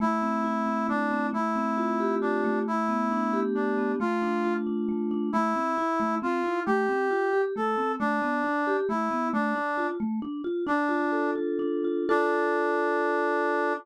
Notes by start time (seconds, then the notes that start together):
0.00 A3 E4
0.22 C4
0.44 E4
0.66 C4
0.89 A3 D4
1.11 C4
1.33 A3 E4
1.56 C4
1.77 F4
2.00 G4
2.21 D4 F4
2.44 A3
2.67 E4
2.89 B3
3.11 D4
3.33 G4
3.55 D4
3.78 B3
4.00 A3 F4
4.22 D4
4.44 F4
4.67 D4
4.89 A3
5.11 D4
5.33 A3 E4
5.55 C4
5.78 E4
6.00 A3
6.22 C4 F4
6.44 E4
6.66 A3 G4
6.89 C4
7.11 F4
7.33 G4
7.56 A3 A4
7.78 C4
8.00 A3 D4
8.22 B3
8.44 D4
8.67 G4
8.89 A3 E4
9.11 B3
9.33 A3 D4
9.56 D4
9.77 F4
10.00 A3
10.22 D4
10.44 F4
10.67 D4
10.89 F4
11.12 A4
11.36 F4
11.59 D4
11.84 F4
12.09 D4 F4 A4